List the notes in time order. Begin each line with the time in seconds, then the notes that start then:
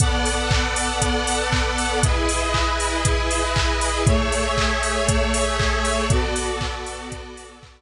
0.00 B3 A4 D5 F#5, kick, closed hi-hat
0.25 open hi-hat
0.51 kick, clap
0.76 open hi-hat
1.02 kick, closed hi-hat
1.27 open hi-hat
1.52 kick, clap
1.78 open hi-hat
2.03 E4 G#4 B4 D#5, kick, closed hi-hat
2.29 open hi-hat
2.54 kick, clap
2.80 open hi-hat
3.05 kick, closed hi-hat
3.31 open hi-hat
3.56 kick, clap
3.81 open hi-hat
4.06 A3 G#4 C#5 E5, kick, closed hi-hat
4.32 open hi-hat
4.57 kick, clap
4.83 open hi-hat
5.08 kick, closed hi-hat
5.34 open hi-hat
5.60 kick, clap
5.85 open hi-hat
6.10 B3 F#4 A4 D5, kick, closed hi-hat
6.36 open hi-hat
6.61 kick, clap
6.86 open hi-hat
7.12 kick, closed hi-hat
7.37 open hi-hat
7.63 kick, clap